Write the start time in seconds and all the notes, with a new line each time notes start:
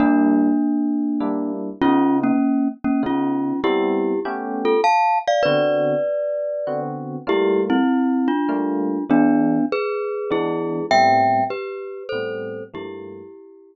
0.00 G3 A#3 D4 E4
1.20 G3 A#3 D4 E4
1.82 C#3 B3 C#4 D#4 F4
2.23 A#3 C#4
2.84 A#3 C#4
3.03 C#3 B3 C#4 D#4 F4
3.64 G3 B3 C4 E4 G4
4.25 A3 B3 C#4 G4
4.65 F4 A4
4.84 F5 A5
5.28 D5 F5
5.43 D3 B3 C4 F#4 B4 D5
6.67 D3 B3 C4 F#4
7.27 G3 A3 A#3 E4 F4 G4
7.70 C4 E4
8.28 D4 F4
8.49 G3 A3 A#3 F4
9.09 E3 G#3 B3 D4
9.72 G#4 B4
10.31 E3 G#3 B3 D4 E4 G#4
10.91 A2 G3 B3 C4 E5 G5
11.50 G4 B4
12.09 A2 G3 B3 C4 A4 C5
12.74 G2 F3 A3 A#3 E4 G4